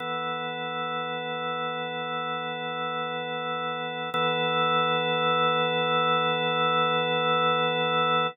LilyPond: \new Staff { \time 4/4 \key e \lydian \tempo 4 = 58 <e b a'>1 | <e b a'>1 | }